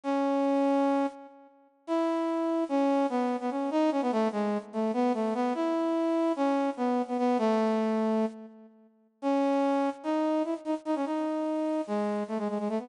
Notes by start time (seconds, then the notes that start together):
0.04 C#4
1.87 E4
2.69 C#4
3.10 B3
3.40 B3
3.51 C#4
3.71 D#4
3.91 C#4
4.02 B3
4.12 A3
4.32 G#3
4.73 A3
4.93 B3
5.14 A3
5.34 B3
5.55 E4
6.36 C#4
6.77 B3
7.08 B3
7.18 B3
7.38 A3
9.22 C#4
10.04 D#4
10.44 E4
10.65 D#4
10.85 D#4
10.95 C#4
11.06 D#4
11.87 G#3
12.28 A3
12.38 G#3
12.48 G#3
12.59 G#3
12.69 A3
12.79 B3